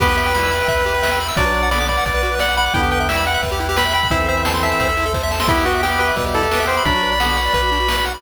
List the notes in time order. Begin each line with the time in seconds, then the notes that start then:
0.00 E2 B3 G4 B4 E5 G5, kick, crash
0.08 B4, closed hi-hat
0.17 E5, closed hi-hat
0.25 G5, closed hi-hat
0.34 G3 E4 B5, snare
0.43 E6, closed hi-hat
0.51 B5, closed hi-hat
0.60 G5, closed hi-hat
0.68 E2 E5, kick, closed hi-hat
0.77 B4, closed hi-hat
0.85 G4, closed hi-hat
0.94 B4, closed hi-hat
1.02 E5, snare
1.11 G5, closed hi-hat
1.20 B5, closed hi-hat
1.28 E6, open hi-hat
1.37 B1 F#3 D4 F#4 B4 D5 F#5, kick, closed hi-hat
1.46 B4, closed hi-hat
1.54 D5, closed hi-hat
1.63 F#5, closed hi-hat
1.71 D3 B3 D5 B5, snare
1.80 D6, closed hi-hat
1.88 D5 B5, kick, closed hi-hat
1.97 F#5, closed hi-hat
2.06 B1 D5, kick, closed hi-hat
2.14 B4, closed hi-hat
2.22 F#4, closed hi-hat
2.31 B4, closed hi-hat
2.39 D5 F#5, snare
2.49 F#5, closed hi-hat
2.57 F#5 B5, closed hi-hat
2.66 D6, closed hi-hat
2.74 E2 D3 B3 E4 B4 E5 G5, kick, closed hi-hat
2.83 G4, closed hi-hat
2.91 B4 G5, closed hi-hat
3.00 E5, closed hi-hat
3.09 G3 E4 E5 G5, snare
3.16 B5, closed hi-hat
3.26 F#5 G5, closed hi-hat
3.34 E5, closed hi-hat
3.43 E2 B4, kick, closed hi-hat
3.51 G4, closed hi-hat
3.60 E4, closed hi-hat
3.69 G4, closed hi-hat
3.77 B4 B5, snare
3.85 E5, closed hi-hat
3.93 G5 B5, closed hi-hat
4.02 B5, kick, closed hi-hat
4.10 E2 E3 C4 E4 A4 C5 E5, kick, closed hi-hat
4.20 A4, closed hi-hat
4.28 C5 E5, closed hi-hat
4.37 E5, closed hi-hat
4.45 A5, snare
4.54 C6, closed hi-hat
4.63 E5 A5, closed hi-hat
4.71 E5, closed hi-hat
4.80 E2 C5, kick, closed hi-hat
4.89 A4, closed hi-hat
4.97 E4, closed hi-hat
5.06 A4, closed hi-hat
5.14 C5, kick, snare
5.23 E5
5.31 A5, snare
5.40 C6, snare
5.48 E2 B3 E4 G4 B4 E5, kick, crash
5.57 G4, closed hi-hat
5.65 F#4 B4, closed hi-hat
5.74 E5, closed hi-hat
5.83 G4 G5, snare
5.91 B5, closed hi-hat
5.99 B4 G5, closed hi-hat
6.09 E5, closed hi-hat
6.16 E2 B2 G3 B4, kick, closed hi-hat
6.25 G4, closed hi-hat
6.34 E4 A4, closed hi-hat
6.42 G4, closed hi-hat
6.51 B3 G4 B4, snare
6.60 E5, closed hi-hat
6.67 C5 G5, closed hi-hat
6.76 B5, closed hi-hat
6.85 B1 F#3 D4 F#4 B4 D5 B5, kick, closed hi-hat
6.94 F#4, closed hi-hat
7.02 B4, closed hi-hat
7.11 D5, closed hi-hat
7.20 D3 B3 F#5, snare
7.29 B5, closed hi-hat
7.37 F#5, closed hi-hat
7.45 D5, closed hi-hat
7.53 B1 B4, kick, closed hi-hat
7.62 F#4, closed hi-hat
7.71 D4, closed hi-hat
7.80 F#4, closed hi-hat
7.88 B4, snare
7.97 D5, closed hi-hat
8.05 F#5, closed hi-hat
8.14 B5, closed hi-hat